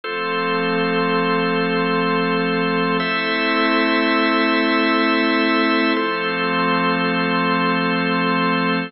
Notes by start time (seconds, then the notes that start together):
0.04 F3 A3 C4 F4 A4 C5
3.00 A3 C4 E4 A4 C5 E5
5.96 F3 A3 C4 F4 A4 C5